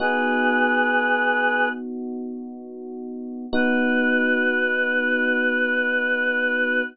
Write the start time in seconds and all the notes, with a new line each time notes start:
0.00 B3 D#4 F#4 G#4 B4
3.53 B3 D#4 F#4 B4